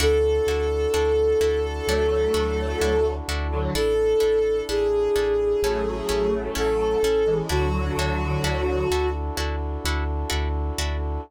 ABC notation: X:1
M:4/4
L:1/16
Q:1/4=64
K:Dlyd
V:1 name="Violin"
A16 | A4 G8 A4 | F8 z8 |]
V:2 name="Lead 1 (square)"
z8 [F,A,]6 z [D,F,] | z8 [F,A,]6 z [E,G,] | [D,F,]6 z10 |]
V:3 name="Orchestral Harp"
[DEFA]2 [DEFA]2 [DEFA]2 [DEFA]2 [DEFA]2 [DEFA]2 [DEFA]2 [DEFA]2 | [DEA]2 [DEA]2 [DEA]2 [DEA]2 [CEA]2 [CEA]2 [CEA]2 [CEA]2 | [DEFA]2 [DEFA]2 [DEFA]2 [DEFA]2 [DEFA]2 [DEFA]2 [DEFA]2 [DEFA]2 |]
V:4 name="Synth Bass 2" clef=bass
D,,2 D,,2 D,,2 D,,2 D,,2 D,,2 D,,2 D,,2 | A,,,2 A,,,2 A,,,2 A,,,2 A,,,2 A,,,2 A,,,2 A,,,2 | D,,2 D,,2 D,,2 D,,2 D,,2 D,,2 D,,2 D,,2 |]
V:5 name="Brass Section"
[DEFA]16 | [DEA]8 [CEA]8 | [DEFA]16 |]